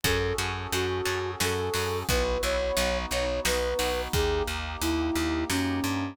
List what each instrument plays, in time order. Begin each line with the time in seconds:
0.04 electric bass (finger) F#2, brass section C#4 F#4 G#4 A4, orchestral harp C#4 F#4 G#4 A4, flute A4, kick, closed hi-hat
0.38 electric bass (finger) F#2, orchestral harp C#4 F#4 G#4 A4, closed hi-hat
0.72 electric bass (finger) F#2, orchestral harp C#4 F#4 G#4 A4, flute F#4, closed hi-hat
1.05 electric bass (finger) F#2, orchestral harp C#4 F#4 G#4 A4, closed hi-hat
1.40 electric bass (finger) F#2, orchestral harp C#4 F#4 G#4 A4, flute A4, snare
1.74 electric bass (finger) F#2, orchestral harp C#4 F#4 G#4 A4, open hi-hat
2.08 electric bass (finger) B1, brass section B3 E4 F#4, orchestral harp B3 E4 F#4, flute B4, kick, closed hi-hat
2.43 electric bass (finger) B1, orchestral harp B3 E4 F#4, flute C#5, closed hi-hat
2.77 electric bass (finger) B1, orchestral harp B3 D#4 F#4, brass section B3 D#4 F#4, closed hi-hat
3.11 electric bass (finger) B1, orchestral harp B3 D#4 F#4, flute C#5, closed hi-hat
3.45 electric bass (finger) B1, orchestral harp B3 D#4 F#4, flute B4, snare
3.79 electric bass (finger) B1, orchestral harp B3 D#4 F#4, open hi-hat
4.13 electric bass (finger) D#2, brass section A#3 D#4 G4, flute G#4, kick, closed hi-hat
4.47 electric bass (finger) D#2, closed hi-hat
4.81 electric bass (finger) D#2, flute E4, closed hi-hat
5.15 electric bass (finger) D#2, closed hi-hat
5.50 electric bass (finger) F#2, flute C#4, snare
5.84 electric bass (finger) G2, closed hi-hat